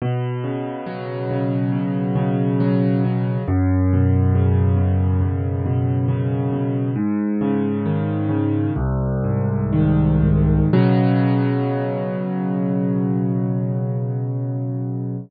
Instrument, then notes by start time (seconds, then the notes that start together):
acoustic grand piano
0.02 B2
0.44 C#3
0.86 F#3
1.31 C#3
1.72 B2
2.16 C#3
2.60 F#3
3.04 C#3
3.48 F#2
3.93 B2
4.35 C#3
4.77 B2
5.22 F#2
5.66 B2
6.08 C#3
6.53 B2
6.96 G#2
7.41 C#3
7.86 D#3
8.29 C#3
8.76 C2
9.24 G#2
9.73 D#3
10.22 G#2
10.73 B2 C#3 F#3